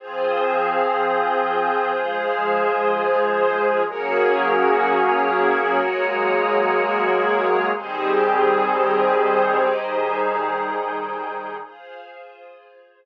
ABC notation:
X:1
M:6/8
L:1/8
Q:3/8=62
K:Fphr
V:1 name="Pad 2 (warm)"
[F,CA]6 | [F,A,A]6 | [G,B,DA]6 | [G,A,B,A]6 |
[E,=G,CA]6 | [E,=G,EA]6 | z6 |]
V:2 name="String Ensemble 1"
[FAc]6- | [FAc]6 | [GABd]6- | [GABd]6 |
[E=GAc]6- | [E=GAc]6 | [FAc]6 |]